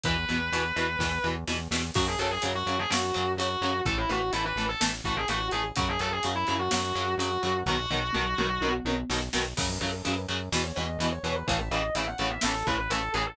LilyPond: <<
  \new Staff \with { instrumentName = "Distortion Guitar" } { \time 4/4 \key fis \dorian \tempo 4 = 126 b'2. r4 | fis'16 gis'16 a'16 gis'16 r16 fis'8 gis'16 fis'4 fis'4 | a'16 e'16 fis'8 e'16 b'8 a'16 r8 fis'16 gis'16 fis'8 gis'16 r16 | fis'16 gis'16 a'16 gis'16 r16 e'8 fis'16 fis'4 fis'4 |
fis'2~ fis'8 r4. | cis''16 b'16 a'16 a'16 b'16 r4 cis''16 dis''8. cis''8 b'16 | a'16 e''16 dis''8 e''16 fis''8 e''16 a'8 b'16 b'16 a'8 gis'16 a'16 | }
  \new Staff \with { instrumentName = "Overdriven Guitar" } { \time 4/4 \key fis \dorian <b, e>8 <b, e>8 <b, e>8 <b, e>8 <b, e>8 <b, e>8 <b, e>8 <b, e>8 | <cis fis>8 <cis fis>8 <cis fis>8 <cis fis>8 <cis fis>8 <cis fis>8 <cis fis>8 <cis fis>8 | <e a>8 <e a>8 <e a>8 <e a>8 <e a>8 <e a>8 <e a>8 <e a>8 | <cis fis>8 <cis fis>8 <cis fis>8 <cis fis>8 <cis fis>8 <cis fis>8 <cis fis>8 <cis fis>8 |
<b, dis fis>8 <b, dis fis>8 <b, dis fis>8 <b, dis fis>8 <b, dis fis>8 <b, dis fis>8 <b, dis fis>8 <b, dis fis>8 | <cis fis>8 <cis fis>8 <cis fis>8 <cis fis>8 <b, e>8 <b, e>8 <b, e>8 <b, e>8 | <a, cis e>8 <a, cis e>8 <a, cis e>8 <a, cis e>8 <a, cis e>8 <a, cis e>8 <a, cis e>8 <a, cis e>8 | }
  \new Staff \with { instrumentName = "Synth Bass 1" } { \clef bass \time 4/4 \key fis \dorian e,8 e,8 e,8 e,8 e,8 e,8 e,8 e,8 | fis,8 fis,8 fis,8 fis,8 fis,8 fis,8 fis,8 fis,8 | a,,8 a,,8 a,,8 a,,8 a,,8 a,,8 a,,8 a,,8 | fis,8 fis,8 fis,8 fis,8 fis,8 fis,8 fis,8 fis,8 |
b,,8 b,,8 b,,8 b,,8 b,,8 b,,8 b,,8 b,,8 | fis,8 fis,8 fis,8 fis,8 e,8 e,8 e,8 e,8 | a,,8 a,,8 a,,8 a,,8 a,,8 a,,8 a,,8 a,,8 | }
  \new DrumStaff \with { instrumentName = "Drums" } \drummode { \time 4/4 <hh bd>8 hh8 hh8 hh8 <bd sn>4 sn8 sn8 | <cymc bd>8 hh8 hh8 hh8 sn8 hh8 hh8 hh8 | <hh bd>8 hh8 hh8 hh8 sn8 <hh bd>8 hh8 hh8 | <hh bd>8 hh8 hh8 hh8 sn8 hh8 hh8 hh8 |
<bd tomfh>8 tomfh8 toml8 toml8 tommh8 tommh8 sn8 sn8 | <cymc bd>8 hh8 hh8 hh8 sn8 hh8 hh8 hh8 | <hh bd>8 hh8 hh8 hh8 sn8 <hh bd>8 hh8 hh8 | }
>>